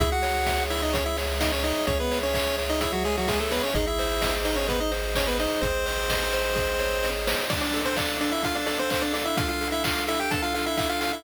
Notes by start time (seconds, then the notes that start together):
0.00 C#2 E4 G#4 E5, kick, closed hi-hat
0.12 F#4 F#5
0.22 C#5, open hi-hat
0.46 E5, kick, snare
0.70 E4 C#5 E5, open hi-hat
0.82 D#4 D#5
0.93 C#4 G#4 C#5, kick, closed hi-hat
1.06 E4 E5
1.17 C#5, open hi-hat
1.40 D#4 D#5 E5, kick, snare
1.52 C#4 C#5
1.64 D#4 C#5 D#5, snare, open hi-hat
1.87 C#2 C#4 G#4 C#5, kick, closed hi-hat
2.00 B3 B4
2.11 C#5, open hi-hat
2.23 C#4 C#5
2.33 C#4 C#5 E5, kick, clap
2.58 C#5, open hi-hat
2.69 D#4 D#5
2.81 E4 G#4 E5, kick, closed hi-hat
2.92 F#3 F#4
3.04 G#3 G#4 C#5, open hi-hat
3.17 F#3 F#4
3.28 G#3 G#4 E5, kick, snare
3.40 A3 A4
3.51 B3 B4 C#5, snare, open hi-hat
3.63 C#4 C#5
3.74 G#1 D#4 G#4 D#5, kick, closed hi-hat
3.87 E4 E5
3.99 C5, open hi-hat
4.21 D#5, kick, snare
4.45 D#4 C5 D#5, open hi-hat
4.56 C#4 C#5
4.67 B3 G#4 B4, kick, closed hi-hat
4.80 D#4 D#5
4.91 C5, open hi-hat
5.15 C#4 C#5 D#5, kick, clap
5.27 B3 B4
5.39 D#4 C5 D#5, snare, open hi-hat
5.61 G#1 C4 G#4 C5, kick, closed hi-hat
5.86 C5, open hi-hat
6.09 D#5, kick, snare
6.33 C5, open hi-hat
6.55 G#4, kick, snare
6.79 C#5, snare
7.03 D#5, snare
7.27 C5, snare
7.50 D4 D5, kick, crash
7.61 D4 D5, closed hi-hat
7.73 A4, open hi-hat
7.85 C4 C5, closed hi-hat
7.97 D4 D5 F5, kick, clap
8.08 closed hi-hat
8.21 D4 A4 D5, open hi-hat
8.31 E4 E5, closed hi-hat
8.42 D4 F4 F5, kick, closed hi-hat
8.55 D4 D5, closed hi-hat
8.66 D4 A4 D5, open hi-hat
8.79 C4 C5, closed hi-hat
8.90 C4 C5 F5, kick, clap
9.01 D4 D5, closed hi-hat
9.12 D4 A4 D5, snare, open hi-hat
9.25 E4 E5, closed hi-hat
9.37 D4 F4 F5, kick, closed hi-hat
9.48 F4 F5, closed hi-hat
9.61 A4, open hi-hat
9.72 E4 E5, closed hi-hat
9.84 F4 F5, kick, clap
9.96 closed hi-hat
10.07 E4 A4 E5, open hi-hat
10.20 G4 G5, closed hi-hat
10.31 D4 A4 A5, kick, closed hi-hat
10.42 F4 F5, closed hi-hat
10.54 F4 A4 F5, open hi-hat
10.66 E4 E5, closed hi-hat
10.77 E4 E5 F5, kick, clap
10.89 F4 F5, closed hi-hat
11.01 F4 A4 F5, snare, open hi-hat
11.13 E4 E5, closed hi-hat